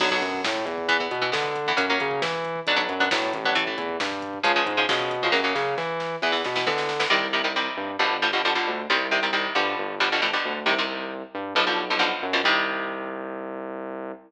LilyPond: <<
  \new Staff \with { instrumentName = "Overdriven Guitar" } { \time 4/4 \key b \minor \tempo 4 = 135 <d fis b>16 <d fis b>4.~ <d fis b>16 <e b>16 <e b>8 <e b>16 <e b>8. <e b>16 | <fis ais cis'>16 <fis ais cis'>4.~ <fis ais cis'>16 <fis b d'>16 <fis b d'>8 <fis b d'>16 <fis b d'>8. <fis b d'>16 | <e a>16 <e a>4.~ <e a>16 <cis eis gis>16 <cis eis gis>8 <cis eis gis>16 <cis eis gis>8. <cis eis gis>16 | <cis fis ais>16 <cis fis ais>4.~ <cis fis ais>16 <e b>16 <e b>8 <e b>16 <e b>8. <e b>16 |
\key c \minor <c ees g>8 <c ees g>16 <c ees g>16 <c ees g>4 <b, d f g>8 <b, d f g>16 <b, d f g>16 <b, d f g>16 <b, d f g>8. | <c ees g>8 <c ees g>16 <c ees g>16 <c ees g>8 <b, d f g>4 <b, d f g>16 <b, d f g>16 <b, d f g>16 <b, d f g>8. | <c ees g>16 <c ees g>4.~ <c ees g>16 <b, d f g>16 <b, d f g>8 <b, d f g>16 <b, d f g>8. <b, d f g>16 | <c ees g>1 | }
  \new Staff \with { instrumentName = "Synth Bass 1" } { \clef bass \time 4/4 \key b \minor b,,8 fis,8 a,8 e,4 b,8 d4 | fis,8 cis8 e4 b,,8 fis,8 a,8 a,,8~ | a,,8 e,8 g,4 cis,8 gis,8 b,4 | fis,8 cis8 e4 e,8 b,8 d4 |
\key c \minor c,4. g,8 g,,4. d,8 | c,4. g,8 g,,4. d,8 | c,4. g,8 b,,4. ges,8 | c,1 | }
  \new DrumStaff \with { instrumentName = "Drums" } \drummode { \time 4/4 <cymc bd>16 bd16 <hh bd>16 bd16 <bd sn>16 bd16 <hh bd>16 bd16 <hh bd>16 bd16 <hh bd>16 bd16 <bd sn>16 bd16 <hh bd>16 bd16 | <hh bd>16 bd16 <hh bd>16 bd16 <bd sn>16 bd16 <hh bd>16 bd16 <hh bd>16 bd16 <hh bd>16 bd16 <bd sn>16 bd16 <hh bd>16 bd16 | <hh bd>16 bd16 <hh bd>16 bd16 <bd sn>16 bd16 <hh bd>16 bd16 <hh bd>16 bd16 <hh bd>16 bd16 <bd sn>16 bd16 <hh bd>16 bd16 | <bd sn>8 sn8 sn8 sn8 sn16 sn16 sn16 sn16 sn16 sn16 sn16 sn16 |
r4 r4 r4 r4 | r4 r4 r4 r4 | r4 r4 r4 r4 | r4 r4 r4 r4 | }
>>